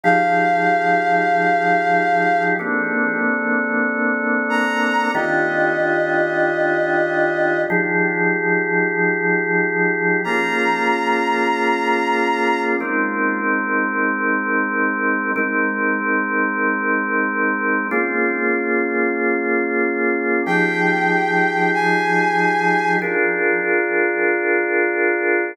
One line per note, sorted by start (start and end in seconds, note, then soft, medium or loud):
0.03 2.54 F3 medium
0.03 2.54 D#4 medium
0.03 2.54 G4 medium
0.03 2.54 G#4 medium
0.03 2.43 F5 medium
2.59 5.09 A#3 medium
2.59 5.09 C4 medium
2.59 5.09 D4 medium
2.59 5.09 A4 medium
4.49 5.11 A#5 medium
5.14 7.65 D#3 medium
5.14 7.65 D4 medium
5.14 7.65 F4 medium
5.14 7.65 G4 medium
5.14 7.60 D#5 soft
7.70 10.20 F3 medium
7.70 10.20 D#4 medium
7.70 10.20 G4 medium
7.70 10.20 G#4 medium
10.24 12.75 A#3 medium
10.24 12.75 C#4 medium
10.24 12.75 F4 medium
10.24 12.75 G#4 medium
10.24 12.61 A#5 medium
12.80 15.31 G#3 medium
12.80 15.31 C4 medium
12.80 15.31 D#4 medium
12.80 15.31 A#4 medium
15.36 17.86 G#3 medium
15.36 17.86 C4 medium
15.36 17.86 D#4 medium
15.36 17.86 A#4 medium
17.91 20.41 A#3 medium
17.91 20.41 C#4 medium
17.91 20.41 F4 medium
17.91 20.41 G#4 medium
20.46 22.97 F3 medium
20.46 22.97 D#4 medium
20.46 22.97 G4 medium
20.46 22.97 G#4 medium
20.46 21.70 G5 medium
21.74 22.93 G#5 medium
23.02 25.52 D4 medium
23.02 25.52 F4 medium
23.02 25.52 G#4 medium
23.02 25.52 A#4 medium